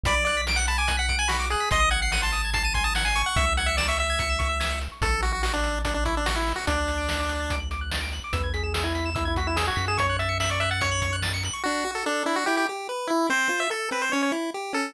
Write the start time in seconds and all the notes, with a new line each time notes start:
0.04 B1 D5 B5, kick, closed hi-hat
0.14 D6
0.25 D5 F#6, closed hi-hat
0.37 B6
0.47 D7, snare
0.56 F#5 F#7
0.67 A5 B5, closed hi-hat
0.78 G#5 D6
0.88 F#6, kick, closed hi-hat
0.97 F#5 B6
1.09 D7, kick, closed hi-hat
1.19 G#5 F#7
1.28 F#4 B5, snare
1.40 D6
1.50 G#4 F#6, closed hi-hat
1.60 B6
1.71 G#1 D#5 C6, kick, closed hi-hat
1.80 D#6
1.91 F#5 G#6, closed hi-hat
2.02 F#5 C7
2.12 F#5 D#7, snare
2.22 A5 C6
2.32 D#6, closed hi-hat
2.45 G#6
2.53 A5 C7, kick, closed hi-hat
2.63 A5 D#7
2.74 G#5 C6, kick, closed hi-hat
2.84 A5 D#6
2.95 F#5 G#6, snare
3.05 G#5 C7
3.16 C#6, closed hi-hat
3.26 F#5
3.36 C#2 E5, kick, closed hi-hat
3.47 E6
3.57 F#5 G#6, closed hi-hat
3.66 E5 C#7
3.77 D5 E7, snare
3.88 E5 C#6
3.98 E5 E6, closed hi-hat
4.10 G#6
4.19 C#7, kick, closed hi-hat
4.30 E7
4.39 C#6, kick, closed hi-hat
4.49 E6
4.60 G#6, snare
4.71 C#7
4.81 E7, closed hi-hat
4.92 C#6
5.01 A1 A4 C#6, kick, closed hi-hat
5.12 E6
5.22 F#4 A6, closed hi-hat
5.32 F#4 C#7
5.43 F#4 E7, snare
5.53 D4 C#6
5.63 E6, closed hi-hat
5.76 A6
5.85 D4 C#7, kick, closed hi-hat
5.94 D4 E7
6.05 E4 C#6, kick, closed hi-hat
6.15 D4 E6
6.26 F#4 A6, snare
6.36 E4 C#7
6.46 E7, open hi-hat
6.56 F#4 C#6
6.67 D2 D4 D6, kick, closed hi-hat
6.77 F#6
6.87 A6, closed hi-hat
6.98 D7
7.08 F#7, snare
7.20 D6
7.29 F#6, closed hi-hat
7.40 A6
7.50 D7, kick, closed hi-hat
7.60 F#7
7.71 D6, closed hi-hat
7.81 F#6
7.91 A6, snare
8.01 D7
8.12 F#7, closed hi-hat
8.24 D6
8.33 E2 B4 E6, kick, closed hi-hat
8.44 G#6
8.54 G#4 B6, closed hi-hat
8.63 G#4 E7
8.74 G#4 E6, snare
8.84 E4 G#6
8.95 B6, closed hi-hat
9.06 E7
9.15 E4 E6, kick, closed hi-hat
9.25 E4 G#6
9.36 F#4 B6, kick, closed hi-hat
9.47 E4 E7
9.56 G#4 E6, snare
9.67 F#4 G#6
9.76 F#2 B6, closed hi-hat
9.88 G#4 E7
9.97 C#5 C#6, kick, closed hi-hat
10.09 F#6
10.19 E5 A6, closed hi-hat
10.29 C#7
10.40 E5 F#7, snare
10.50 D5 C#6
10.60 E5 F#6, closed hi-hat
10.71 F#5 A6
10.81 C#5 C#7, kick, closed hi-hat
10.91 F#7
11.02 C#6, kick, closed hi-hat
11.13 F#6
11.22 A6, snare
11.34 C#7
11.43 F#7, closed hi-hat
11.53 C#6
11.64 D4 F#4
11.85 F#4
11.95 A4
12.06 D4 A4
12.26 D4 E4
12.36 F#4
12.46 E4 G4
12.57 G4
12.69 G4
12.89 B4
13.07 E4
13.30 C4 C5
13.49 F4
13.60 E5
13.70 A4
13.91 C4 B4
14.02 C5
14.12 C#4 C#5
14.23 C#5
14.32 E4
14.54 G4
14.73 C#4 A4